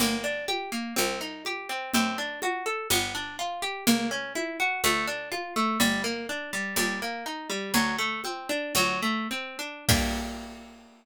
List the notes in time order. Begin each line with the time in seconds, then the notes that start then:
0.00 G1 A#3, low conga
0.24 D4
0.48 G4, high conga
0.72 A#3
0.96 C2 C4, high conga
1.21 D#4
1.45 G4, high conga
1.69 C4
1.94 F#2 C4, low conga
2.18 D4
2.42 F#4, high conga
2.66 A4
2.90 G1 B3, high conga
3.15 D4
3.39 F4
3.62 G4
3.87 C#2 A#3, low conga
4.11 C#4
4.35 E4, high conga
4.60 F#4
4.84 D2 A3, high conga
5.07 D4
5.32 F4, high conga
5.56 A3
5.80 G1 G3, low conga
6.04 A#3
6.29 D4
6.53 G3
6.76 D#2 G3, high conga
7.02 A#3
7.26 D#4
7.50 G3
7.74 D2 F#3, low conga
7.98 A3
8.24 C4, high conga
8.49 D4
8.75 D2 F#3, high conga
9.02 A3
9.31 C4
9.59 D4
9.89 G2 A#3 D4 G4, kick, crash